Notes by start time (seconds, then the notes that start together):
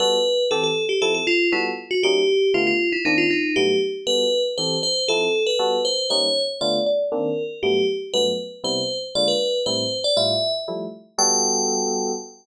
0.00 G3 B3 F#4 A4 B4
0.51 E3 C4 G4 A4
0.64 A4
0.89 G4
1.02 F3 C4 E4 A4
1.14 A4
1.27 F4
1.52 G3 B3 E4 F#4 A4
1.91 F#4
2.03 G3 A#3 C#4 D#4 G4
2.54 D3 A3 B3 F4
2.67 F4
2.92 E4
3.05 D#3 A#3 C4 D4 D#4
3.18 F4
3.30 D#4
3.56 G2 F#3 A3 B3 G4
4.07 G3 B3 F#4 A4 B4
4.58 E3 C4 G4 A4 C5
4.83 C5
5.08 F3 C4 E4 A4
5.47 B4
5.59 G3 B3 F#4 A4
5.85 C5
6.10 G3 A#3 C#4 D#4 C#5
6.61 D3 A3 B3 F4 D5
6.86 D5
7.12 D#3 A#3 C4 D4 A#4
7.63 G2 F#3 A3 B3 G4
8.14 G2 F#3 A3 B3 B4
8.64 C3 G3 B3 E4 C5
9.15 D3 G#3 A#3 F4 D5
9.28 B4
9.66 A2 G3 C4 E4 C5
10.04 D5
10.16 A2 G3 E4 F4 E5
10.68 F3 G3 A3 E4
11.18 G3 B3 F#4 A4 G5